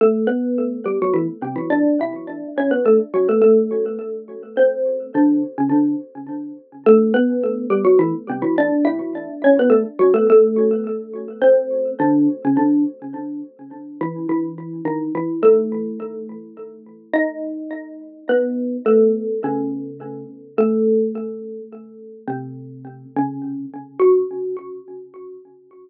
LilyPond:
\new Staff { \time 6/8 \key fis \phrygian \tempo 4. = 70 <a a'>8 <b b'>4 <g g'>16 <fis fis'>16 <e e'>16 r16 <c c'>16 <e e'>16 | <d' d''>8 <e' e''>4 <cis' cis''>16 <b b'>16 <a a'>16 r16 <fis fis'>16 <a a'>16 | <a a'>2 <c' c''>4 | <d d'>8 r16 <cis cis'>16 <d d'>8 r4. |
<a a'>8 <b b'>4 <g g'>16 <fis fis'>16 <e e'>16 r16 <c c'>16 <e e'>16 | <d' d''>8 <e' e''>4 <cis' cis''>16 <b b'>16 <a a'>16 r16 <fis fis'>16 <a a'>16 | <a a'>2 <c' c''>4 | <d d'>8 r16 <cis cis'>16 <d d'>8 r4. |
\key gis \phrygian r8 <e e'>8 <e e'>4 <dis dis'>8 <e e'>8 | <a a'>2 r4 | <dis' dis''>2 <b b'>4 | <a a'>4 <cis cis'>4. r8 |
\key fis \phrygian <a a'>2 r4 | <c c'>4. <cis cis'>4 r8 | fis'2. | }